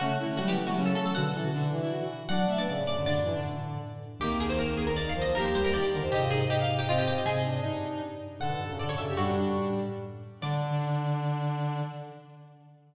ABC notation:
X:1
M:3/4
L:1/16
Q:1/4=157
K:D
V:1 name="Pizzicato Strings"
F4 F G2 F2 A A A | f6 z6 | [M:2/4] f3 d3 d2 | [M:3/4] d8 z4 |
[K:Eb] G2 A c B2 A B (3d2 f2 e2 | [M:2/4] B c c B d d z2 | [M:3/4] G2 A2 G z2 G F G G2 | A8 z4 |
[M:2/4] [K:D] f4 d c e2 | [M:3/4] "^rit." F8 z4 | d12 |]
V:2 name="Violin"
C z E C A,3 B, C C z2 | F z A F D3 E F F z2 | [M:2/4] d2 e z d2 d2 | [M:3/4] D4 z8 |
[K:Eb] B,8 B2 c2 | [M:2/4] G4 G2 B c | [M:3/4] e4 e f z2 e4 | e4 E4 z4 |
[M:2/4] [K:D] A4 A3 G | [M:3/4] "^rit." D2 D4 z6 | D12 |]
V:3 name="Brass Section"
A,2 A,2 G, E,2 E, C,4 | D, z E,2 D,2 E,4 z2 | [M:2/4] D3 B, C,2 C, D, | [M:3/4] D,2 E, D,5 z4 |
[K:Eb] E,8 z E, F, F, | [M:2/4] B,2 G,2 E,2 D, E, | [M:3/4] E F E E E4 C4 | C2 D6 z4 |
[M:2/4] [K:D] D,3 C, D,2 C, C, | [M:3/4] "^rit." G,8 z4 | D,12 |]
V:4 name="Vibraphone"
C,3 D, F,2 F, A, F,4 | [B,,D,]8 z4 | [M:2/4] F,2 A,2 A,,3 F,, | [M:3/4] G,, F,,2 A,,5 z4 |
[K:Eb] [C,,E,,]12 | [M:2/4] E,,2 D,, D,,2 E,,2 F,, | [M:3/4] [A,,C,]12 | [A,,C,]4 G,,6 z2 |
[M:2/4] [K:D] A,, B,, G,, F,, A,,2 F,, F,, | [M:3/4] "^rit." G,, F,,2 A,,5 z4 | D,12 |]